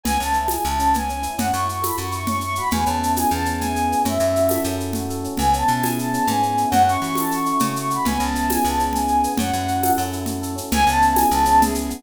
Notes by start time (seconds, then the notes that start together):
0.04 C#2 B3 G#5, low conga, shaker
0.19 C#2 C#4 A5, shaker
0.33 E4, shaker
0.48 G#4 G#5, tambourine, high conga, shaker
0.65 C#2 E4 A5, shaker
0.79 C#4, shaker
0.94 B3 G#5, low conga, shaker
1.09 C#4, shaker
1.23 E4, shaker
1.38 F#2 C#4 F#5, low conga, shaker
1.53 F#2 E4 C#6, shaker
1.68 F#4, shaker
1.82 A4 B5, tambourine, high conga, shaker
1.97 F#2 F#4 C#6, shaker
2.12 E4 C#6, shaker
2.27 C#4 C#6, low conga, shaker
2.41 E4 C#6, shaker
2.55 F#4 B5, shaker
2.71 E2 B3 G#5, low conga, shaker
2.86 E2 C#4 A5, shaker
3.01 E4, shaker
3.16 G#4 G#5, tambourine, high conga, shaker
3.30 E2 B3 A5, shaker
3.45 C#4, shaker
3.59 E4 G#5, low conga, shaker
3.75 G#4, shaker
3.89 B3, shaker
4.05 F#2 C#4 E5, low conga, shaker
4.19 F#2 E4, shaker
4.36 F#4, shaker
4.49 A4, tambourine, high conga, shaker
4.64 F#2 C#4, shaker
4.78 E4, shaker
4.93 F#4, low conga, shaker
5.09 A4, shaker
5.24 C#4, shaker
5.37 C#2 B3 G#5, low conga, shaker
5.53 C#4 A5, shaker
5.68 B2 E4, shaker
5.82 G#4 G#5, tambourine, high conga, shaker
5.99 E4 A5, shaker
6.13 C#4, shaker
6.27 G#2 B3 G#5, low conga, shaker
6.42 C#4, shaker
6.57 E4, shaker
6.70 F#2 C#4 F#5, low conga, shaker
6.87 E4 C#6, shaker
7.02 E3 F#4, shaker
7.15 A4 A5, tambourine, high conga, shaker
7.31 F#4 C#6, shaker
7.46 E4 C#6, shaker
7.60 C#3 C#4 C#6, low conga, shaker
7.76 E4 C#6, shaker
7.90 F#4 B5, shaker
8.05 C#2 B3 G#5, low conga, shaker
8.19 C#2 C#4 A5, shaker
8.35 E4, shaker
8.50 G#4 G#5, tambourine, high conga, shaker
8.64 C#2 B3 A5, shaker
8.79 C#4, shaker
8.93 E4 G#5, low conga, shaker
9.08 G#4, shaker
9.24 B3, shaker
9.37 F#2 C#4 F#5, low conga, shaker
9.53 F#2 E4, shaker
9.67 F#4, shaker
9.82 A4, tambourine, high conga, shaker
9.98 F#2 C#4, shaker
10.13 E4, shaker
10.26 F#4, low conga, shaker
10.42 A4, shaker
10.56 C#4, shaker
10.72 C#2 B3 G#5, low conga, shaker
10.87 C#2 C#4 A5, shaker
11.02 E4, shaker
11.16 G#4 G#5, tambourine, high conga, shaker
11.30 C#2 B3 A5, shaker
11.45 C#4, shaker
11.60 E4 G#4, low conga, shaker
11.75 G#4, shaker
11.90 B3, shaker